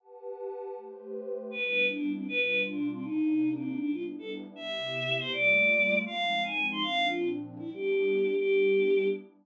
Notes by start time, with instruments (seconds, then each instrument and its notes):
0.00 pad 2 (warm) G4 B4 F#5 A5
0.76 pad 2 (warm) A3 G4 B4 C5
1.51 pad 2 (warm) G3 B3 D4 E4, choir aahs B4
1.64 choir aahs B4
1.89 choir aahs D4
2.14 choir aahs C4
2.28 pad 2 (warm) B2 G3 D4 F4, choir aahs B4
2.40 choir aahs B4
2.67 choir aahs D4
2.92 choir aahs C4
3.03 pad 2 (warm) C3 A#3 D4 D#4, choir aahs D#4
3.54 choir aahs C4
3.79 pad 2 (warm) G3 B3 D4 E4, choir aahs D4
3.92 choir aahs F4
4.19 choir aahs A4
4.56 pad 2 (warm) C3 B3 E4 G4, choir aahs E5
5.19 choir aahs C5
5.31 pad 2 (warm) G3 A3 A#3 F4, choir aahs D5
6.06 pad 2 (warm) F3 G#3 C4 D#4, choir aahs F5
6.43 choir aahs G#5
6.71 choir aahs C6
6.82 pad 2 (warm) A#2 F3 C4 D4, choir aahs F5
7.07 choir aahs F4
7.59 pad 2 (warm) G3 B3 D4 E4, choir aahs E4
7.74 choir aahs G4
8.35 pad 2 (warm) G3 B3 D4 E4, choir aahs G4